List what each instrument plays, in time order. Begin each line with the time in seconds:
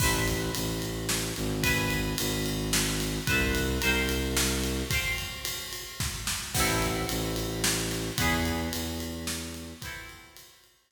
0.00 violin A1, overdriven guitar B4 C5 E5, kick, crash
0.05 overdriven guitar A5
0.28 ride
0.54 violin A1, ride
0.82 ride
1.09 snare
1.36 violin G#1, ride
1.63 overdriven guitar B4 E5 G#5, kick, ride
1.90 ride
2.18 violin G#1, ride
2.46 ride
2.73 snare
3.00 ride
3.27 violin C2, overdriven guitar B4 C5 E5, kick, ride
3.33 overdriven guitar A5
3.55 ride
3.81 violin C2, overdriven guitar A#4 C5 F5, ride
3.87 overdriven guitar G5
4.09 ride
4.37 snare
4.64 ride
4.90 overdriven guitar C5 F5, kick, ride
4.95 overdriven guitar G5
5.18 ride
5.45 ride
5.73 ride
6.00 kick, snare
6.27 snare
6.54 violin A1, overdriven guitar B3 C4 E4, kick, crash
6.60 overdriven guitar A4
6.82 ride
7.09 violin A1, ride
7.36 ride
7.64 snare
7.91 ride
8.18 violin E2, overdriven guitar B3 E4 G#4, kick, ride
8.45 ride
8.73 violin E2, ride
9.00 ride
9.27 snare
9.54 ride
9.81 overdriven guitar B3 C4 E4, kick, ride
9.87 overdriven guitar A4
10.09 ride
10.36 ride
10.64 ride
10.91 snare